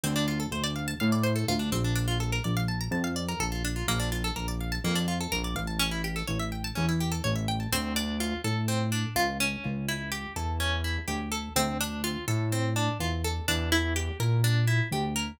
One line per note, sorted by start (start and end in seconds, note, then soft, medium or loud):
0.04 0.47 D2 loud
0.04 0.14 C4 medium
0.16 0.27 D4 medium
0.28 0.39 F4 medium
0.40 0.51 A4 medium
0.51 0.95 D2 medium
0.51 0.63 C5 medium
0.64 0.74 D5 medium
0.76 0.86 F5 medium
0.88 0.99 A5 medium
1.00 1.44 A2 medium
1.00 1.11 F5 medium
1.12 1.23 D5 medium
1.24 1.34 C5 medium
1.36 1.46 A4 medium
1.48 1.71 D2 loud
1.48 1.59 F4 medium
1.59 1.70 D4 medium
1.72 2.39 A#1 loud
1.72 1.83 C4 medium
1.84 1.95 D4 medium
1.96 2.06 D4 medium
2.08 2.19 F4 medium
2.20 2.31 A4 medium
2.32 2.43 A#4 medium
2.44 2.88 A#1 medium
2.44 2.55 D5 medium
2.57 2.68 F5 medium
2.68 2.79 A5 medium
2.81 2.92 A#5 medium
2.91 3.34 F2 loud
2.91 3.03 A5 medium
3.04 3.15 F5 medium
3.16 3.27 D5 medium
3.29 3.39 A#4 medium
3.40 3.83 A#1 medium
3.40 3.51 A4 medium
3.52 3.63 F4 medium
3.65 3.75 D4 medium
3.76 3.87 F4 medium
3.87 4.31 A#1 loud
3.87 3.99 A#3 medium
4.00 4.10 D4 medium
4.12 4.23 F4 medium
4.24 4.35 A4 medium
4.36 4.79 A#1 medium
4.36 4.47 A#4 medium
4.48 4.59 D5 medium
4.61 4.71 F5 medium
4.72 4.83 A5 medium
4.84 5.27 F2 medium
4.84 4.95 A#3 medium
4.96 5.06 D4 medium
5.08 5.19 F4 medium
5.21 5.31 A4 medium
5.32 5.55 A#1 medium
5.32 5.43 A#4 medium
5.44 5.55 D5 medium
5.55 6.23 A1 loud
5.55 5.67 F5 medium
5.67 5.78 A5 medium
5.79 5.90 C#4 medium
5.91 6.02 E4 medium
6.04 6.15 G4 medium
6.16 6.27 A4 medium
6.28 6.72 A1 medium
6.28 6.38 C#5 medium
6.40 6.50 E5 medium
6.52 6.63 G5 medium
6.64 6.75 A5 medium
6.75 7.21 E2 medium
6.75 6.86 C#4 medium
6.89 6.99 E4 medium
7.00 7.11 G4 medium
7.12 7.22 A4 medium
7.24 7.68 A1 medium
7.24 7.35 C#5 medium
7.36 7.46 E5 medium
7.48 7.59 G5 medium
7.60 7.71 A5 medium
7.72 8.34 D2 medium
7.72 7.94 C4 loud
7.96 8.18 D4 medium
8.20 8.42 F4 medium
8.44 9.05 A2 medium
8.44 8.66 A4 medium
8.68 8.90 C4 medium
8.92 9.14 D4 medium
9.15 9.56 C#2 medium
9.15 9.38 F4 loud
9.40 9.86 C#4 loud
9.65 10.27 C#2 medium
9.88 10.10 E4 medium
10.12 10.33 G4 medium
10.36 10.97 E2 medium
10.36 10.58 A4 medium
10.60 10.82 C#4 medium
10.84 11.06 E4 medium
11.08 11.49 D2 medium
11.08 11.29 G4 medium
11.32 11.53 A4 medium
11.56 12.17 D2 loud
11.56 11.78 C4 loud
11.81 12.02 D4 medium
12.04 12.25 F4 medium
12.28 12.89 A2 medium
12.28 12.49 A4 medium
12.52 12.74 C4 medium
12.76 12.98 D4 medium
13.00 13.40 E2 medium
13.00 13.22 F4 medium
13.24 13.46 A4 medium
13.48 14.09 E2 loud
13.48 13.70 D4 medium
13.72 13.94 E4 medium
13.96 14.18 G4 medium
14.20 14.81 A#2 medium
14.20 14.42 A#4 medium
14.44 14.66 D4 loud
14.68 14.89 E4 medium
14.91 15.32 D2 medium
14.91 15.14 G4 medium
15.16 15.37 A#4 medium